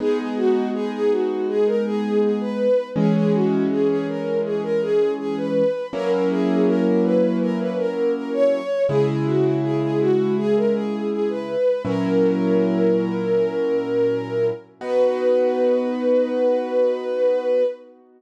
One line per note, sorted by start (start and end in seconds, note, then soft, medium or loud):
0.00 2.67 G#3 loud
0.00 2.67 B3 loud
0.00 2.67 D#4 loud
0.00 0.18 G#4 loud
0.18 0.36 G#4 medium
0.37 0.68 F#4 loud
0.74 0.92 G#4 loud
0.93 1.10 G#4 loud
1.11 1.47 F#4 medium
1.48 1.66 G#4 loud
1.66 1.84 A#4 loud
1.85 2.19 G#4 loud
2.22 2.40 G#4 medium
2.40 2.86 B4 loud
2.96 5.62 E3 loud
2.96 5.62 G#3 loud
2.96 5.62 C#4 loud
2.96 3.14 G#4 loud
3.15 3.32 G#4 loud
3.33 3.66 F#4 medium
3.70 3.88 G#4 medium
3.88 4.06 G#4 medium
4.08 4.38 A#4 medium
4.44 4.62 G#4 medium
4.63 4.80 A#4 loud
4.82 5.11 G#4 loud
5.19 5.36 G#4 loud
5.37 5.86 B4 medium
5.93 8.60 F#3 loud
5.93 8.60 A#3 loud
5.93 8.60 C#4 loud
5.93 8.60 E4 loud
5.93 6.10 A#4 loud
6.11 6.29 A#4 medium
6.30 6.66 G#4 loud
6.67 6.84 A#4 loud
6.85 7.03 A#4 medium
7.03 7.37 B4 loud
7.41 7.58 A#4 loud
7.59 7.77 B4 medium
7.78 8.12 A#4 medium
8.15 8.32 A#4 medium
8.33 8.82 C#5 loud
8.89 11.56 C#3 loud
8.89 11.56 G#3 loud
8.89 11.56 E4 loud
8.89 9.06 G#4 loud
9.08 9.25 G#4 medium
9.26 9.58 F#4 medium
9.63 9.80 G#4 medium
9.82 9.99 G#4 medium
10.00 10.34 F#4 loud
10.37 10.55 G#4 loud
10.56 10.74 A#4 medium
10.74 11.08 G#4 medium
11.12 11.29 G#4 medium
11.29 11.83 B4 medium
11.85 14.51 A#2 loud
11.85 14.51 F#3 loud
11.85 14.51 C#4 loud
11.85 14.51 E4 loud
11.85 14.45 A#4 loud
14.81 17.63 B3 loud
14.81 17.63 D#4 medium
14.81 17.63 F#4 loud
14.81 17.63 B4 loud